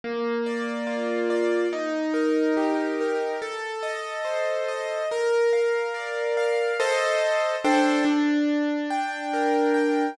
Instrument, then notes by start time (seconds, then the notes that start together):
acoustic grand piano
0.04 A#3
0.46 D5
0.87 F4
1.30 D5
1.73 D#4
2.14 A#4
2.57 G4
3.01 A#4
3.42 A4
3.83 D#5
4.25 C5
4.68 D#5
5.11 A#4
5.53 F5
5.94 D5
6.37 F5
6.80 A4 C5 D#5
7.64 D4 A4 C5 G5
8.05 D4
8.90 G5
9.33 A#4
9.74 G5